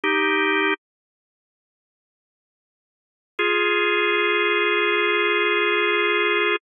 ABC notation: X:1
M:4/4
L:1/8
Q:"Swing" 1/4=72
K:Bb
V:1 name="Drawbar Organ"
[EG]2 z6 | [F_A]8 |]